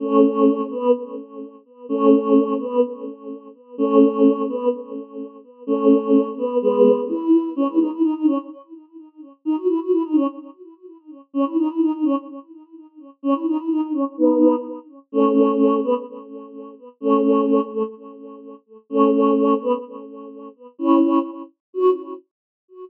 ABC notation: X:1
M:2/4
L:1/16
Q:1/4=127
K:F#dor
V:1 name="Choir Aahs"
[A,C]6 B,2 | z8 | [A,C]6 B,2 | z8 |
[A,C]6 B,2 | z8 | [A,C]6 B,2 | [G,B,]4 E4 |
C E D E D D C z | z8 | D F E F E D C z | z8 |
C E D E D D C z | z8 | C E D E D D C z | [B,D]4 z4 |
[A,C]6 B, z | z8 | [A,C]6 A, z | z8 |
[A,C]6 B, z | z8 | [CE]4 z4 | F4 z4 |]